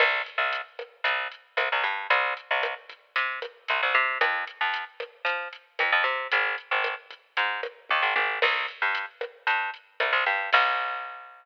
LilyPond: <<
  \new Staff \with { instrumentName = "Electric Bass (finger)" } { \clef bass \time 4/4 \key c \minor \tempo 4 = 114 c,8. c,4~ c,16 c,4 c,16 c,16 g,8 | c,8. c,4~ c,16 c4 c,16 c,16 c8 | f,8. f,4~ f,16 f4 f,16 f,16 c8 | aes,,8. aes,,4~ aes,,16 aes,4 ees,16 aes,,16 aes,,8 |
c,8. g,4~ g,16 g,4 c,16 c,16 g,8 | c,1 | }
  \new DrumStaff \with { instrumentName = "Drums" } \drummode { \time 4/4 <cymc bd ss>8 hh8 hh8 <hh bd ss>8 <hh bd>8 hh8 <hh ss>8 <hh bd>8 | <hh bd>8 hh8 <hh ss>8 <hh bd>8 <hh bd>8 <hh ss>8 hh8 <hh bd>8 | <hh bd ss>8 hh8 hh8 <hh bd ss>8 <hh bd>8 hh8 <hh ss>8 <hh bd>8 | <hh bd>8 hh8 <hh ss>8 <hh bd>8 <hh bd>8 <hh ss>8 <bd tommh>8 tommh8 |
<cymc bd ss>8 hh8 hh8 <hh bd ss>8 <hh bd>8 hh8 <hh ss>8 <hh bd>8 | <cymc bd>4 r4 r4 r4 | }
>>